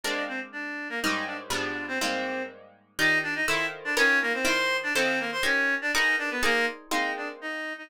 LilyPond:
<<
  \new Staff \with { instrumentName = "Clarinet" } { \time 2/2 \key aes \lydian \tempo 2 = 122 <d' d''>4 <c' c''>8 r8 <d' d''>4. <bes bes'>8 | <ees' ees''>4 <d' d''>8 r8 <d' d''>4. <c' c''>8 | <c' c''>2 r2 | \key ees \lydian <ees' ees''>4 <d' d''>8 <ees' ees''>8 <e' e''>8. r8. <d' d''>8 |
<des' des''>4 <bes bes'>8 <c' c''>8 <c'' c'''>4. <d' d''>8 | <c' c''>4 <bes bes'>8 <c'' c'''>8 <des' des''>4. <d' d''>8 | <ees' ees''>4 <d' d''>8 <ces' ces''>8 <bes bes'>4 r4 | \key aes \lydian <ees' ees''>4 <d' d''>8 r8 <ees' ees''>4. <ees' ees''>8 | }
  \new Staff \with { instrumentName = "Acoustic Guitar (steel)" } { \time 2/2 \key aes \lydian <aes bes c' d'>1 | <aes, g bes des' ees'>2 <aes, f g b d'>2 | <aes, g bes c' ees'>1 | \key ees \lydian <ees f' g' d''>2 <ees e' f' a' c''>2 |
<ees f' bes' ces'' des''>2 <ees e' bes' c'' d''>2 | <ees e' f' a' c''>2 <ees' g' bes' des''>2 | <ees' ges' aes' bes' ces''>2 <ees' aes' bes' c'' d''>2 | \key aes \lydian <aes bes c' ees'>1 | }
>>